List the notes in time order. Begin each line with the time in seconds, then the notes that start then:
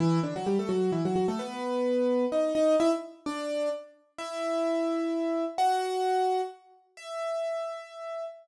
0.00 E3 E4
0.23 D3 D4
0.36 F#3 F#4
0.47 G3 G4
0.59 A3 A4
0.69 F#3 F#4
0.92 E3 E4
1.05 F#3 F#4
1.16 F#3 F#4
1.28 A3 A4
1.39 B3 B4
2.32 D#4 D#5
2.55 D#4 D#5
2.80 E4 E5
3.26 D4 D5
4.18 E4 E5
5.58 F#4 F#5
6.97 E5